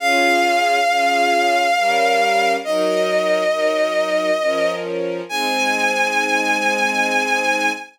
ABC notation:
X:1
M:3/4
L:1/8
Q:1/4=68
K:Ab
V:1 name="Violin"
f6 | e5 z | a6 |]
V:2 name="String Ensemble 1"
[DFA]2 [DFA]2 [G,DB]2 | [_G,EB]2 [G,EB]2 [F,DB]2 | [A,CE]6 |]